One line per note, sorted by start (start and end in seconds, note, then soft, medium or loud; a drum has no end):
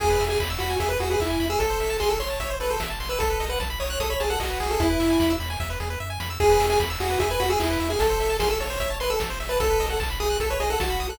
0.00 0.17 E2 loud
0.00 0.09 G#4 medium
0.00 0.25 G#4 medium
0.00 kick loud
0.00 crash loud
0.10 0.19 B4 medium
0.20 0.37 E2 medium
0.20 0.29 E5 medium
0.20 open hi-hat medium
0.29 0.39 G#4 medium
0.29 0.39 G#5 medium
0.40 0.57 E2 medium
0.40 0.49 B5 medium
0.40 kick medium
0.40 clap loud
0.50 0.59 E6 medium
0.59 0.77 E2 medium
0.59 0.76 F#4 medium
0.59 0.69 B5 medium
0.59 open hi-hat medium
0.70 0.79 G#5 medium
0.80 0.97 E2 medium
0.80 0.89 G#4 medium
0.80 0.89 E5 medium
0.80 kick medium
0.80 closed hi-hat loud
0.89 0.98 B4 medium
0.89 0.99 B4 medium
1.00 1.17 E2 medium
1.00 1.10 F#4 medium
1.00 1.09 G#4 medium
1.00 open hi-hat medium
1.10 1.21 G#4 medium
1.10 1.19 B4 medium
1.20 1.37 E2 medium
1.20 1.46 E4 medium
1.20 1.29 E5 medium
1.20 kick medium
1.20 clap medium
1.30 1.39 G#5 medium
1.40 1.57 E2 medium
1.40 1.49 B5 medium
1.40 open hi-hat medium
1.50 1.59 G#4 medium
1.50 1.59 E6 medium
1.59 1.77 A1 medium
1.59 1.97 A4 medium
1.59 1.69 A4 medium
1.59 kick medium
1.59 closed hi-hat medium
1.70 1.79 C5 medium
1.80 1.97 A1 medium
1.80 1.89 E5 medium
1.80 open hi-hat medium
1.90 1.99 A5 medium
2.00 2.17 A1 medium
2.00 2.09 G#4 medium
2.00 2.09 C6 medium
2.00 kick medium
2.00 clap medium
2.09 2.18 A4 medium
2.09 2.19 E6 medium
2.20 2.37 A1 medium
2.20 2.53 C#5 medium
2.20 2.29 C6 medium
2.20 open hi-hat medium
2.30 2.39 A5 medium
2.40 2.57 A1 medium
2.40 2.49 E5 medium
2.40 kick medium
2.40 closed hi-hat medium
2.50 2.59 C5 medium
2.60 2.77 A1 medium
2.60 2.69 A4 medium
2.60 2.70 B4 medium
2.60 open hi-hat medium
2.70 2.80 A4 medium
2.70 2.79 C5 medium
2.80 2.97 A1 medium
2.80 2.89 E5 medium
2.80 kick medium
2.80 snare loud
2.90 2.99 A5 medium
3.00 3.17 A1 medium
3.00 3.09 C6 medium
3.00 open hi-hat medium
3.09 3.19 B4 medium
3.09 3.19 E6 medium
3.19 3.37 B1 medium
3.19 3.45 A4 medium
3.19 3.29 A4 medium
3.19 kick medium
3.19 closed hi-hat loud
3.30 3.39 B4 medium
3.40 3.57 B1 medium
3.40 3.49 D#5 medium
3.40 open hi-hat medium
3.49 3.59 B4 medium
3.49 3.59 F#5 medium
3.60 3.77 B1 medium
3.60 3.69 A5 medium
3.60 kick medium
3.60 snare medium
3.70 3.79 B5 medium
3.80 3.97 B1 medium
3.80 3.99 C#5 medium
3.80 3.89 D#6 medium
3.80 open hi-hat medium
3.90 3.99 F#6 medium
4.00 4.17 B1 medium
4.00 4.10 A4 medium
4.00 4.09 D#6 medium
4.00 kick medium
4.00 closed hi-hat medium
4.10 4.20 C#5 medium
4.10 4.19 B5 medium
4.20 4.37 B1 medium
4.20 4.30 G#4 medium
4.20 4.29 A5 medium
4.20 open hi-hat medium
4.30 4.40 A4 medium
4.30 4.39 F#5 medium
4.40 4.57 B1 medium
4.40 4.69 F#4 medium
4.40 4.49 D#5 medium
4.40 kick medium
4.40 clap loud
4.50 4.59 B4 medium
4.60 4.77 B1 medium
4.60 4.89 G#4 medium
4.60 open hi-hat medium
4.71 4.80 A4 medium
4.80 4.97 E2 loud
4.80 5.32 E4 medium
4.80 kick loud
4.80 closed hi-hat loud
4.90 4.99 B4 medium
5.00 5.17 E2 medium
5.00 5.09 E5 medium
5.00 open hi-hat medium
5.10 5.19 G#5 medium
5.20 5.37 E2 medium
5.20 5.29 B5 medium
5.20 kick medium
5.20 snare loud
5.30 5.39 E6 medium
5.40 5.57 E2 medium
5.40 5.49 B5 medium
5.40 open hi-hat medium
5.50 5.59 G#5 medium
5.60 5.77 E2 medium
5.60 5.69 E5 medium
5.60 kick medium
5.60 snare medium
5.70 5.79 B4 medium
5.80 5.97 E2 medium
5.80 5.89 G#4 medium
5.80 snare medium
5.90 5.99 B4 medium
6.00 6.18 F#2 medium
6.00 6.09 E5 medium
6.10 6.19 G#5 medium
6.20 6.38 F2 medium
6.20 6.29 B5 medium
6.20 snare loud
6.30 6.39 E6 medium
6.40 6.57 E2 medium
6.40 6.49 G#4 medium
6.40 6.66 G#4 loud
6.40 kick loud
6.40 crash loud
6.50 6.59 B4 medium
6.60 6.77 E2 medium
6.60 6.69 E5 medium
6.60 open hi-hat medium
6.70 6.79 G#4 medium
6.70 6.79 G#5 medium
6.80 6.97 E2 medium
6.80 6.89 B5 medium
6.80 kick medium
6.80 snare medium
6.90 6.99 E6 medium
7.00 7.17 E2 medium
7.00 7.19 F#4 medium
7.00 7.09 G#4 medium
7.00 open hi-hat medium
7.10 7.19 B4 medium
7.19 7.37 E2 medium
7.19 7.29 G#4 medium
7.19 7.29 E5 medium
7.19 kick medium
7.19 closed hi-hat loud
7.30 7.40 B4 medium
7.30 7.39 G#5 medium
7.40 7.57 E2 medium
7.40 7.49 F#4 medium
7.40 7.49 B5 medium
7.40 open hi-hat medium
7.50 7.59 G#4 medium
7.50 7.59 E6 medium
7.60 7.77 E2 medium
7.60 7.89 E4 medium
7.60 7.69 G#4 medium
7.60 kick medium
7.60 clap loud
7.70 7.79 B4 medium
7.80 7.97 E2 medium
7.80 7.89 E5 medium
7.80 open hi-hat medium
7.90 7.99 G#4 medium
7.90 7.99 G#5 medium
7.99 8.17 A1 loud
7.99 8.37 A4 loud
7.99 8.09 A4 medium
7.99 kick loud
7.99 closed hi-hat loud
8.10 8.19 C5 medium
8.20 8.37 A1 medium
8.20 8.29 E5 medium
8.20 open hi-hat medium
8.30 8.39 A5 medium
8.39 8.57 A1 medium
8.39 8.49 G#4 medium
8.39 8.49 C6 medium
8.39 kick medium
8.39 snare loud
8.49 8.58 A4 medium
8.49 8.59 E6 medium
8.60 8.77 A1 medium
8.60 8.69 A4 medium
8.60 8.96 C#5 medium
8.60 open hi-hat medium
8.70 8.79 C5 medium
8.80 8.97 A1 medium
8.80 8.89 E5 medium
8.80 kick medium
8.80 closed hi-hat loud
8.90 8.99 A5 medium
9.00 9.17 A1 medium
9.00 9.10 B4 medium
9.00 9.09 C6 medium
9.00 open hi-hat medium
9.10 9.19 A4 medium
9.10 9.19 E6 medium
9.20 9.37 A1 medium
9.20 9.29 A4 medium
9.20 kick medium
9.20 snare loud
9.30 9.39 C5 medium
9.40 9.57 A1 medium
9.40 9.49 E5 medium
9.40 open hi-hat medium
9.49 9.59 B4 medium
9.49 9.59 A5 medium
9.60 9.77 B1 medium
9.60 9.69 A4 medium
9.60 9.86 A4 loud
9.60 kick loud
9.60 closed hi-hat loud
9.70 9.79 B4 medium
9.80 9.97 B1 medium
9.80 9.89 D#5 medium
9.80 open hi-hat medium
9.90 10.00 A4 medium
9.90 9.99 F#5 medium
10.00 10.17 B1 medium
10.00 10.09 A5 medium
10.00 kick medium
10.00 clap loud
10.10 10.19 B5 medium
10.20 10.37 B1 medium
10.20 10.38 G#4 medium
10.20 10.29 D#6 medium
10.20 open hi-hat medium
10.30 10.39 F#6 medium
10.40 10.57 B1 medium
10.40 10.49 A4 medium
10.40 10.50 A4 medium
10.40 kick medium
10.40 closed hi-hat loud
10.50 10.59 B4 medium
10.50 10.60 C#5 medium
10.60 10.77 B1 medium
10.60 10.69 G#4 medium
10.60 10.69 D#5 medium
10.60 open hi-hat medium
10.70 10.80 A4 medium
10.70 10.79 F#5 medium
10.80 10.97 B1 medium
10.80 11.07 F#4 medium
10.80 10.89 A5 medium
10.80 kick medium
10.80 snare loud
10.90 10.99 B5 medium
11.00 11.17 B1 medium
11.00 11.09 D#6 medium
11.00 open hi-hat medium
11.09 11.18 A4 medium
11.09 11.18 F#6 medium